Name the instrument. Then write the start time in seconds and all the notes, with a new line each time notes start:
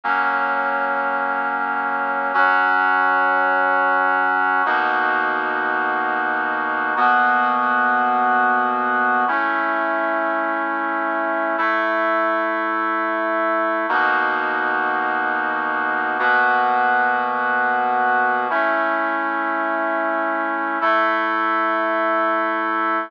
brass section
0.04 F#3 A#3 C#4
2.34 F#3 C#4 F#4
4.66 B2 A#3 D#4 F#4
6.96 B2 A#3 B3 F#4
9.28 A3 C#4 E4
11.58 A3 E4 A4
13.89 B2 A#3 D#4 F#4
16.19 B2 A#3 B3 F#4
18.50 A3 C#4 E4
20.81 A3 E4 A4